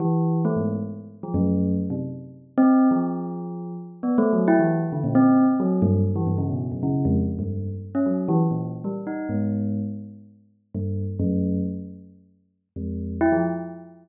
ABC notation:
X:1
M:5/4
L:1/16
Q:1/4=134
K:none
V:1 name="Tubular Bells"
E,4 A, _A,,2 z4 F, _G,,4 z C, z2 | z3 C3 F,8 z2 (3B,2 A,2 _G,2 | E E,2 z D, _B,, C3 z _G,2 =G,,2 z E, G,, _D, =B,,2 | _G,, _D,2 F,, z2 =G,,3 z2 _D _G,2 E, z _B,,2 z =G, |
z _E2 _A,,5 z8 G,,3 z | _G,,4 z10 F,,4 E F, |]